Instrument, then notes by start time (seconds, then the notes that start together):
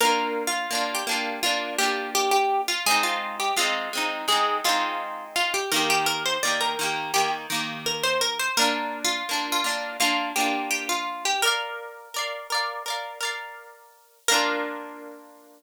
acoustic guitar (steel)
0.00 A#3 D4 A#4
0.05 F4
0.47 F4
0.71 A#3 D4
0.75 F4
0.95 G4
1.07 A#3 D4
1.11 F4
1.43 A#3 D4 F4
1.78 A#3 D4 G4
1.83 F4
2.15 G4
2.31 G4
2.68 F4
2.86 G#3 C4 G#4
2.91 D#4
3.03 F4
3.40 G4
3.57 G#3 C4 F4
3.61 D#4
3.93 G#3 C4
3.97 D#4
4.28 G#3 C4 G#4
4.32 D#4
4.64 G#3 C4 F4
4.69 D#4
5.36 F4
5.54 G4
5.72 D#3 A#3 A#4
5.76 G4
5.90 G4
6.06 A#4
6.26 C5
6.43 D#3 A#3 D5
6.47 G4
6.61 A#4
6.79 D#3 A#3
6.83 G4
7.14 D#3 A#3 G4
7.50 D#3 A#3
7.54 G4
7.86 A#4
8.03 C5
8.21 A#4
8.39 C5
8.57 A#3 D4 A#4
8.61 F4
9.04 F4
9.29 A#3 D4
9.33 F4
9.52 F4
9.64 A#3 D4
9.69 F4
10.00 A#3 D4 F4
10.36 A#3 D4 G4
10.40 F4
10.71 G4
10.89 F4
11.25 G4
11.42 A#4 D5
11.47 F5
12.14 A#4 D5
12.19 F5
12.50 A#4 D5
12.55 F5
12.86 A#4 D5
12.90 F5
13.21 A#4 D5
13.25 F5
14.28 A#3 D4 A#4
14.34 F4